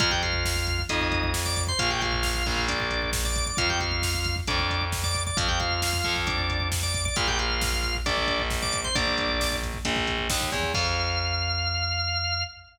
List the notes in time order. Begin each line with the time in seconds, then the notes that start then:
0.00 F2 F4 F5, kick, closed hi-hat
0.11 G4 G5, kick
0.23 F4 F5, kick, closed hi-hat
0.33 kick
0.45 kick, snare
0.56 kick
0.67 kick, closed hi-hat
0.79 kick
0.89 F2 D#4 D#5, kick, closed hi-hat
1.01 kick
1.12 kick, closed hi-hat
1.23 kick
1.33 kick, snare
1.46 D5 D6, kick
1.56 kick, closed hi-hat
1.67 C5 C6, kick
1.79 A#1 F4 F5, kick, closed hi-hat
1.90 G4 G5, kick
2.01 F4 F5, kick, closed hi-hat
2.12 kick
2.23 kick, snare
2.35 kick
2.46 A#1, kick, closed hi-hat
2.57 kick
2.68 D4 D5, kick, closed hi-hat
2.80 kick
2.91 kick, closed hi-hat
3.02 kick
3.12 kick, snare
3.25 D5 D6, kick
3.36 kick, closed hi-hat
3.46 D5 D6, kick
3.57 F2 F4 F5, kick, closed hi-hat
3.70 G4 G5, kick
3.80 F4 F5, kick, closed hi-hat
3.92 kick
4.02 kick, snare
4.15 kick
4.24 kick, closed hi-hat
4.36 kick
4.47 F2 D4 D5, kick, closed hi-hat
4.59 kick
4.70 kick, closed hi-hat
4.81 kick
4.92 kick, snare
5.04 D5 D6, kick
5.15 kick, closed hi-hat
5.26 D5 D6, kick
5.37 F2 F4 F5, kick, closed hi-hat
5.48 G4 G5, kick
5.60 F4 F5, kick, closed hi-hat
5.71 kick
5.82 kick, snare
5.93 kick
6.04 F2, kick, closed hi-hat
6.16 kick
6.27 D4 D5, kick, closed hi-hat
6.38 kick
6.50 kick, closed hi-hat
6.60 kick
6.72 kick, snare
6.82 D5 D6, kick
6.94 kick, closed hi-hat
7.05 D5 D6, kick
7.16 A#1 F4 F5, kick, closed hi-hat
7.28 G4 G5, kick
7.38 F4 F5, kick, closed hi-hat
7.50 kick
7.61 kick, snare
7.73 kick
7.83 kick, closed hi-hat
7.95 kick
8.06 A#1 D4 D5, kick, closed hi-hat
8.18 kick
8.27 kick, closed hi-hat
8.39 kick
8.50 kick, snare
8.62 D5 D6, kick
8.73 kick, closed hi-hat
8.84 C5 C6, kick
8.95 A#1 D4 D5, kick, closed hi-hat
9.07 kick
9.18 kick, closed hi-hat
9.29 kick
9.40 kick, snare
9.52 kick
9.63 kick, closed hi-hat
9.74 kick
9.85 A#1, kick, closed hi-hat
9.96 kick
10.07 kick, closed hi-hat
10.18 kick
10.30 D#2, kick, snare
10.41 kick
10.52 E2, kick, closed hi-hat
10.63 kick
10.74 F2 F5, kick, crash